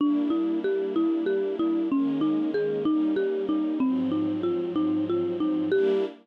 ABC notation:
X:1
M:6/8
L:1/8
Q:3/8=63
K:Gm
V:1 name="Marimba"
D =E G E G E | _D E _A E G E | C E F E F E | G3 z3 |]
V:2 name="String Ensemble 1"
[G,B,D=E]6 | [E,_A,B,_D]3 [G,B,DE]3 | [_A,,F,_G,C]6 | [G,B,D=E]3 z3 |]